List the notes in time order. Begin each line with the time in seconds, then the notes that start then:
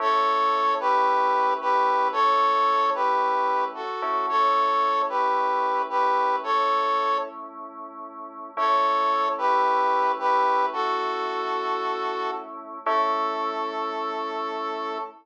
0.00 A3 C#4 E4 A4 C#5
0.80 G4 B4
1.61 G4 B4
2.12 A4 C#5
2.95 G4 B4
3.75 F#4 A4
4.02 A3 C#4 E4
4.29 A4 C#5
5.09 G4 B4
5.90 G4 B4
6.44 A4 C#5
8.57 A3 C#4 E4 A4 C#5
9.38 G4 B4
10.19 G4 B4
10.73 F#4 A4
12.86 A3 C#4 E4 A4